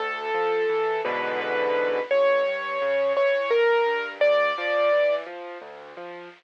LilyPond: <<
  \new Staff \with { instrumentName = "Acoustic Grand Piano" } { \time 6/8 \key d \minor \tempo 4. = 57 a'4. b'8 b'4 | cis''4. cis''8 bes'4 | d''4. r4. | }
  \new Staff \with { instrumentName = "Acoustic Grand Piano" } { \clef bass \time 6/8 \key d \minor d,8 f8 e8 <e, gis, b, d>4. | a,,8 g,8 cis8 e8 a,,8 g,8 | d,8 f8 e8 f8 d,8 f8 | }
>>